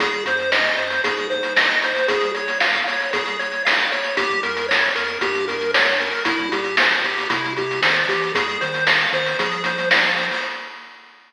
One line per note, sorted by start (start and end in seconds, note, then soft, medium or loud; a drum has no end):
0.00 0.22 G#1 medium
0.00 0.24 G#4 loud
0.00 kick loud
0.00 closed hi-hat loud
0.13 closed hi-hat medium
0.25 0.70 F#2 medium
0.25 0.51 C5 medium
0.25 closed hi-hat loud
0.39 closed hi-hat medium
0.52 0.76 D#5 medium
0.52 snare loud
0.65 closed hi-hat medium
0.77 1.00 F#2 loud
0.77 1.02 C5 medium
0.77 closed hi-hat medium
0.90 closed hi-hat medium
1.04 1.93 G#2 medium
1.04 1.27 G#4 medium
1.04 kick loud
1.04 closed hi-hat loud
1.17 closed hi-hat medium
1.30 1.53 C5 medium
1.30 kick medium
1.30 closed hi-hat medium
1.43 closed hi-hat medium
1.57 1.80 D#5 loud
1.57 snare loud
1.69 closed hi-hat medium
1.82 2.07 C5 medium
1.82 closed hi-hat loud
1.96 closed hi-hat medium
2.08 2.32 G#4 loud
2.08 kick loud
2.08 closed hi-hat loud
2.21 closed hi-hat medium
2.34 2.58 C#5 medium
2.34 closed hi-hat medium
2.48 closed hi-hat medium
2.60 2.84 F5 medium
2.60 snare loud
2.74 kick medium
2.74 closed hi-hat medium
2.87 3.11 C#5 medium
2.87 closed hi-hat loud
3.00 closed hi-hat medium
3.13 3.37 G#4 loud
3.13 kick loud
3.13 closed hi-hat loud
3.26 closed hi-hat medium
3.39 3.63 C#5 medium
3.39 closed hi-hat medium
3.52 closed hi-hat medium
3.65 3.89 F5 medium
3.65 snare loud
3.80 closed hi-hat medium
3.92 4.15 C#5 medium
3.92 closed hi-hat medium
4.04 closed hi-hat medium
4.17 4.40 G1 medium
4.17 4.41 G4 loud
4.17 kick loud
4.17 closed hi-hat loud
4.30 kick medium
4.30 closed hi-hat medium
4.43 4.89 F2 medium
4.43 4.67 A#4 medium
4.43 closed hi-hat medium
4.57 closed hi-hat medium
4.69 4.92 C#5 medium
4.69 snare loud
4.83 closed hi-hat medium
4.95 5.18 F2 medium
4.95 5.19 A#4 medium
4.95 closed hi-hat loud
5.08 closed hi-hat medium
5.21 6.10 G2 medium
5.21 5.45 G4 loud
5.21 kick loud
5.21 closed hi-hat loud
5.35 closed hi-hat medium
5.48 5.71 A#4 medium
5.48 kick medium
5.48 closed hi-hat medium
5.61 closed hi-hat medium
5.74 5.98 C#5 medium
5.74 snare loud
5.87 closed hi-hat medium
6.00 6.24 A#4 loud
6.00 closed hi-hat medium
6.13 closed hi-hat medium
6.25 6.49 C2 loud
6.25 6.49 E4 loud
6.25 kick loud
6.25 closed hi-hat loud
6.39 kick loud
6.39 closed hi-hat medium
6.52 6.96 A#2 medium
6.52 6.76 G4 medium
6.52 closed hi-hat loud
6.64 closed hi-hat medium
6.77 7.03 C5 medium
6.77 snare loud
6.91 closed hi-hat medium
7.04 7.26 A#2 medium
7.04 7.28 G4 medium
7.04 closed hi-hat medium
7.18 closed hi-hat medium
7.30 7.80 C3 medium
7.30 7.53 E4 loud
7.30 kick loud
7.30 closed hi-hat loud
7.44 closed hi-hat medium
7.57 7.81 G4 medium
7.57 kick medium
7.57 closed hi-hat medium
7.71 closed hi-hat medium
7.82 8.05 D#3 medium
7.82 8.07 C5 medium
7.82 snare loud
7.97 closed hi-hat medium
8.08 8.32 E3 medium
8.08 8.32 G4 medium
8.08 closed hi-hat loud
8.22 closed hi-hat medium
8.34 8.57 F2 loud
8.34 8.58 G#4 loud
8.34 kick loud
8.34 closed hi-hat loud
8.49 closed hi-hat medium
8.61 9.06 D#3 medium
8.61 8.84 C5 medium
8.61 closed hi-hat medium
8.74 closed hi-hat medium
8.86 9.10 F5 medium
8.86 snare loud
9.00 closed hi-hat medium
9.13 9.35 D#3 medium
9.13 9.37 C5 loud
9.13 closed hi-hat medium
9.26 closed hi-hat medium
9.39 10.28 F3 medium
9.39 9.63 G#4 loud
9.39 kick medium
9.39 closed hi-hat loud
9.52 closed hi-hat medium
9.64 9.89 C5 medium
9.64 kick medium
9.64 closed hi-hat loud
9.78 closed hi-hat medium
9.91 10.14 F5 medium
9.91 snare loud
10.04 closed hi-hat medium
10.16 10.41 C5 medium
10.16 closed hi-hat medium
10.31 open hi-hat medium